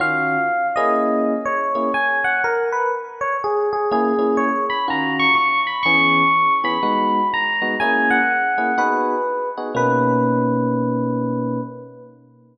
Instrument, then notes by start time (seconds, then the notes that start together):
electric piano 1
0.00 D#3 C#4 F4 F#4 F5
0.76 A#3 C#4 E4 G#4 D#5
1.45 C#5
1.75 A#3 C#4 E4 G#4
1.94 G#5
2.24 F#5
2.44 A#4
2.72 B4
3.21 C#5
3.44 G#4
3.73 G#4
3.91 A#3 C#4 E4 G#4
4.19 A#3 C#4 E4 G#4
4.37 C#5
4.70 B5
4.88 D#3 C#4 F4 F#4 A#5
5.19 C#6
5.35 C#6
5.67 B5
5.83 E3 B3 C#4 G#4 C#6
6.64 E3 B3 C#4 G#4 B5
6.83 G#3 B3 D#4 F#4
7.34 A#5
7.62 G#3 B3 D#4 F#4
7.80 A#3 C#4 E4 G#4 G#5
8.10 F#5
8.58 A#3 C#4 E4 G#4
8.78 B3 D#4 F#4 G#4 B4
9.58 B3 D#4 F#4 G#4
9.75 B2 A#3 C#4 D#4 B4